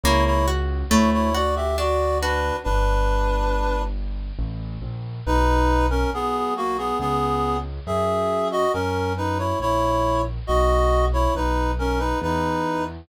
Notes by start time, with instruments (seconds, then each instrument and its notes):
0.03 acoustic grand piano C#2, orchestral harp A#3, clarinet E4 C#5
0.26 clarinet E4 C#5
0.48 orchestral harp F#4
0.90 acoustic grand piano D2, orchestral harp A3, clarinet E4 C#5
1.13 clarinet E4 C#5
1.34 clarinet F#4 D5, orchestral harp F#4
1.56 clarinet G4 E5
1.78 orchestral harp D4, clarinet F#4 D5
2.21 clarinet D4 B4, orchestral harp F#4
2.64 acoustic grand piano G1, clarinet D4 B4
4.39 acoustic grand piano A1
4.82 acoustic grand piano A#1
5.26 acoustic grand piano B1, clarinet D#4 B4
5.90 clarinet C#4 A#4
6.13 acoustic grand piano B1, clarinet B3 G#4
6.57 clarinet A#3 F#4
6.78 clarinet B3 G#4
6.99 acoustic grand piano C#2, clarinet B3 G#4
7.87 acoustic grand piano F#2, clarinet G#4 E5
8.51 clarinet F#4 D#5
8.73 acoustic grand piano F#2, clarinet C#4 A#4
9.17 clarinet D#4 B4
9.38 clarinet E4 C#5
9.59 acoustic grand piano A#1, clarinet E4 C#5
10.47 acoustic grand piano B1, clarinet F#4 D#5
11.13 clarinet E4 C#5
11.35 acoustic grand piano B1, clarinet D#4 B4
11.79 clarinet C#4 A#4
11.99 clarinet D#4 B4
12.21 acoustic grand piano E2, clarinet D#4 B4